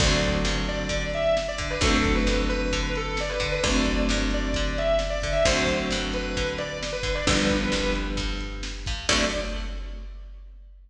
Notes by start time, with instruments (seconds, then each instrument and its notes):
0.00 electric bass (finger) D2, acoustic guitar (steel) D3 F#3 A3, distortion guitar D5, kick, crash
0.05 acoustic guitar (steel) C4
0.23 kick, closed hi-hat
0.45 electric bass (finger) G2, snare
0.68 distortion guitar D5, closed hi-hat
0.89 electric bass (finger) D3, kick, closed hi-hat
1.13 distortion guitar E5, closed hi-hat
1.37 snare
1.48 distortion guitar D5
1.58 electric bass (finger) D3, kick, closed hi-hat
1.70 distortion guitar B4
1.81 electric bass (finger) D2, acoustic guitar (steel) D3 F#3, distortion guitar A4, kick, closed hi-hat
1.85 acoustic guitar (steel) A3 C4
2.05 kick, closed hi-hat
2.15 distortion guitar B4
2.27 electric bass (finger) G2, snare
2.49 distortion guitar B4, closed hi-hat
2.72 electric bass (finger) D3, kick, closed hi-hat
2.95 distortion guitar A4, closed hi-hat
3.17 distortion guitar D5, snare
3.29 distortion guitar B4
3.40 electric bass (finger) D3, kick, closed hi-hat
3.52 distortion guitar B4
3.63 electric bass (finger) D2, acoustic guitar (steel) D3 F#3, distortion guitar D5, kick, closed hi-hat
3.67 acoustic guitar (steel) A3 C4
3.85 kick, closed hi-hat
4.09 electric bass (finger) G2, snare
4.31 distortion guitar D5, closed hi-hat
4.54 electric bass (finger) D3, kick, closed hi-hat
4.78 distortion guitar E5, closed hi-hat
4.99 snare
5.10 distortion guitar D5
5.22 electric bass (finger) D3, kick, closed hi-hat
5.32 distortion guitar E5
5.45 electric bass (finger) D2, acoustic guitar (steel) D3 F#3 A3, distortion guitar C5, kick, closed hi-hat
5.51 acoustic guitar (steel) C4
5.67 kick, closed hi-hat
5.91 electric bass (finger) G2, snare
6.13 distortion guitar B4, closed hi-hat
6.37 electric bass (finger) D3, kick, closed hi-hat
6.58 distortion guitar D5, closed hi-hat
6.83 snare
6.93 distortion guitar B4
7.03 electric bass (finger) D3, kick, closed hi-hat
7.15 distortion guitar D5
7.27 electric bass (finger) G1, acoustic guitar (steel) D3 F3 G3, distortion guitar B4, kick, closed hi-hat
7.33 acoustic guitar (steel) B3
7.50 kick, closed hi-hat
7.72 electric bass (finger) C2, snare
7.95 closed hi-hat
8.17 electric bass (finger) G2, kick, closed hi-hat
8.40 closed hi-hat
8.63 snare
8.86 electric bass (finger) G2, kick, closed hi-hat
9.09 electric bass (finger) D2, acoustic guitar (steel) D3 F#3 A3, distortion guitar D5, kick, crash
9.14 acoustic guitar (steel) C4